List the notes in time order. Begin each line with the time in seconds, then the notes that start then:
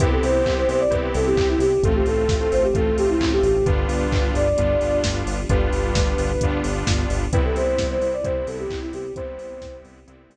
0.00 C2 B3 C4 E4 G4 B4, kick, closed hi-hat
0.11 A4
0.23 C2 C5, open hi-hat
0.46 C2, kick, clap
0.57 C5
0.69 C2 C5, open hi-hat
0.80 D5
0.91 C2 B3 C4 E4 G4 B4, kick, closed hi-hat
1.14 C2 A4, open hi-hat
1.26 G4
1.36 C2, kick, clap
1.49 E4
1.59 C2 G4, open hi-hat
1.83 A1 A3 C4 F4 A4, kick, closed hi-hat
1.95 G4
2.06 A1 A4, open hi-hat
2.28 A1, kick, snare
2.40 A4
2.52 A1 C5, open hi-hat
2.63 G4
2.74 A1 A3 C4 F4 A4, kick, closed hi-hat
2.97 A1 G4, open hi-hat
3.09 E4
3.21 A1, kick, clap
3.32 G4
3.43 A1 G4, open hi-hat
3.66 G1 G3 B3 D4 F4 B4, kick, closed hi-hat
3.88 G1, open hi-hat
4.12 G1, kick, clap
4.34 G1 D5, open hi-hat
4.57 G1 G3 B3 D4 F4, kick, closed hi-hat
4.81 G1, open hi-hat
5.04 G1, kick, snare
5.26 G1, open hi-hat
5.49 G1 G3 B3 D4 F4 B4, kick, closed hi-hat
5.73 G1, open hi-hat
5.95 G1, kick, snare
6.18 G1, open hi-hat
6.41 G1 G3 B3 D4 F4, kick, closed hi-hat
6.64 G1, open hi-hat
6.86 G1, kick, snare
7.09 G1, open hi-hat
7.32 C2 G3 B3 C4 E4 B4, kick, closed hi-hat
7.44 A4
7.56 C2 C5, open hi-hat
7.78 C2, kick, snare
7.90 C5
8.01 C2 C5, open hi-hat
8.13 D5
8.24 C2 G3 B3 C4 E4 C5, kick, closed hi-hat
8.47 C2 A4, open hi-hat
8.59 G4
8.70 C2, kick, clap
8.82 E4
8.93 C2 G4, open hi-hat
9.16 C2 G3 B3 C4 E4 C5, kick, closed hi-hat
9.38 C2, open hi-hat
9.62 C2, kick, snare
9.85 C2, open hi-hat
10.07 C2 G3 B3 C4 E4, closed hi-hat
10.29 C2, open hi-hat